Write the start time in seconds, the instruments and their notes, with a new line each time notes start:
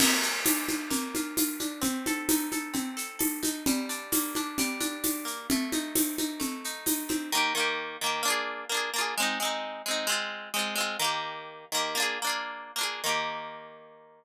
0.00 acoustic guitar (steel) A#3, crash, low conga, shaker
0.23 acoustic guitar (steel) F4, shaker
0.45 acoustic guitar (steel) D4, tambourine, high conga, shaker
0.69 acoustic guitar (steel) F4, high conga, shaker
0.90 acoustic guitar (steel) A#3, low conga, shaker
1.15 acoustic guitar (steel) F4, high conga, shaker
1.37 acoustic guitar (steel) F4, tambourine, high conga, shaker
1.60 acoustic guitar (steel) D4, high conga, shaker
1.81 acoustic guitar (steel) C4, low conga, shaker
2.06 acoustic guitar (steel) A4, high conga, shaker
2.29 acoustic guitar (steel) D#4, tambourine, high conga, shaker
2.52 acoustic guitar (steel) A4, high conga, shaker
2.74 acoustic guitar (steel) C4, low conga, shaker
2.97 acoustic guitar (steel) A4, shaker
3.19 acoustic guitar (steel) A4, tambourine, high conga
3.43 acoustic guitar (steel) D#4, high conga, shaker
3.66 acoustic guitar (steel) G3, low conga, shaker
3.89 acoustic guitar (steel) D4, shaker
4.12 acoustic guitar (steel) A#3, tambourine, high conga, shaker
4.35 acoustic guitar (steel) D4, high conga, shaker
4.58 acoustic guitar (steel) G3, low conga, shaker
4.80 acoustic guitar (steel) D4, high conga, shaker
5.04 acoustic guitar (steel) D4, tambourine, high conga, shaker
5.25 acoustic guitar (steel) A#3, shaker
5.50 acoustic guitar (steel) A3, low conga, shaker
5.72 acoustic guitar (steel) D#4, high conga, shaker
5.95 acoustic guitar (steel) C4, tambourine, high conga, shaker
6.18 acoustic guitar (steel) D#4, high conga, shaker
6.40 acoustic guitar (steel) A3, low conga, shaker
6.64 acoustic guitar (steel) D#4, shaker
6.86 acoustic guitar (steel) D#4, tambourine, high conga, shaker
7.09 acoustic guitar (steel) C4, high conga, shaker
7.32 acoustic guitar (steel) D#3 A#3
7.37 acoustic guitar (steel) G4
7.55 acoustic guitar (steel) D#3 A#3
7.60 acoustic guitar (steel) G4
8.01 acoustic guitar (steel) D#3 A#3
8.06 acoustic guitar (steel) G4
8.23 acoustic guitar (steel) A#3 D4
8.28 acoustic guitar (steel) F4 G#4
8.69 acoustic guitar (steel) A#3 D4
8.74 acoustic guitar (steel) F4 G#4
8.94 acoustic guitar (steel) A#3 D4
8.98 acoustic guitar (steel) F4 G#4
9.18 acoustic guitar (steel) G#3 C4
9.22 acoustic guitar (steel) D#4
9.40 acoustic guitar (steel) G#3 C4
9.45 acoustic guitar (steel) D#4
9.86 acoustic guitar (steel) G#3 C4
9.91 acoustic guitar (steel) D#4
10.07 acoustic guitar (steel) G#3 C4
10.12 acoustic guitar (steel) F4
10.54 acoustic guitar (steel) G#3 C4
10.59 acoustic guitar (steel) F4
10.75 acoustic guitar (steel) G#3 C4
10.80 acoustic guitar (steel) F4
10.99 acoustic guitar (steel) D#3 A#3
11.04 acoustic guitar (steel) G4
11.72 acoustic guitar (steel) D#3 A#3
11.77 acoustic guitar (steel) G4
11.95 acoustic guitar (steel) A#3 D4
12.00 acoustic guitar (steel) F4 G#4
12.22 acoustic guitar (steel) A#3 D4
12.27 acoustic guitar (steel) F4 G#4
12.76 acoustic guitar (steel) A#3 D4
12.81 acoustic guitar (steel) F4 G#4
13.04 acoustic guitar (steel) D#3 A#3
13.09 acoustic guitar (steel) G4